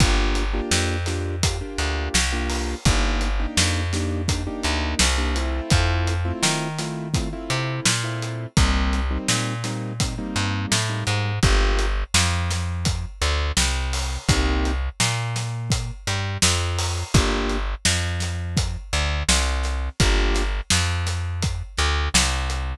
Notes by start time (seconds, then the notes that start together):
0.00 G1 A#3 D4 F4 G4, kick, closed hi-hat
0.35 closed hi-hat
0.53 A#3 D4 F4 G4
0.71 F2, snare
1.06 A#3 D4 F4 G4, snare, closed hi-hat
1.43 A#3 D4 F4 G4, kick, closed hi-hat
1.61 A#3 D4 F4 G4
1.78 D2, closed hi-hat
2.14 C2, snare
2.33 A#3 D4 F4 G4
2.50 open hi-hat
2.85 G1 A#3 D4 D#4 G4, kick, closed hi-hat
3.21 closed hi-hat
3.39 A#3 D4 D#4 G4
3.57 F2, snare
3.93 A#3 D4 D#4 G4, snare, closed hi-hat
4.28 A#3 D4 D#4 G4, kick, closed hi-hat
4.47 A#3 D4 D#4 G4
4.63 D2, closed hi-hat
4.99 C2, snare
5.18 A#3 D4 D#4 G4
5.35 A3 C4 E4 F4, closed hi-hat
5.70 F2, kick, closed hi-hat
6.07 closed hi-hat
6.25 A3 C4 E4 F4
6.43 D#3, snare
6.79 A3 C4 E4 F4, snare, closed hi-hat
7.14 A3 C4 E4 F4, kick, closed hi-hat
7.33 A3 C4 E4 F4
7.50 C3, closed hi-hat
7.85 A#2, snare
8.04 A3 C4 E4 F4
8.22 closed hi-hat
8.57 C2 G3 A#3 C4 D#4, kick, closed hi-hat
8.93 closed hi-hat
9.11 G3 A#3 C4 D#4
9.28 A#2, snare
9.64 G3 A#3 C4 D#4, snare, closed hi-hat
10.00 G3 A#3 C4 D#4, kick, closed hi-hat
10.18 G3 A#3 C4 D#4
10.36 G2, closed hi-hat
10.72 A2, snare
10.89 G3 A#3 C4 D#4
11.07 G#2, closed hi-hat
11.43 G1 A#3 D4 F4 G4, kick, closed hi-hat
11.79 closed hi-hat
12.14 F2 F3, snare
12.50 snare, closed hi-hat
12.85 kick, closed hi-hat
13.21 D2 D3, closed hi-hat
13.57 C2 C3, snare
13.93 open hi-hat
14.29 C2 A#3 C4 D#4 G4, kick, closed hi-hat
14.65 closed hi-hat
15.00 A#2 A#3, snare
15.36 snare, closed hi-hat
15.70 kick, closed hi-hat
16.07 G2 G3, closed hi-hat
16.42 F2 F3, snare
16.79 open hi-hat
17.14 G1 A#3 D4 F4 G4, kick, closed hi-hat
17.49 closed hi-hat
17.85 F2 F3, snare
18.20 snare, closed hi-hat
18.57 kick, closed hi-hat
18.93 D2 D3, closed hi-hat
19.29 C2 C3, snare
19.63 snare, closed hi-hat
20.00 G1 A#3 D4 F4 G4, kick, closed hi-hat
20.35 snare, closed hi-hat
20.70 F2 F3, snare
21.07 snare, closed hi-hat
21.42 kick, closed hi-hat
21.77 D2 D3, snare, closed hi-hat
22.14 C2 C3, snare
22.50 closed hi-hat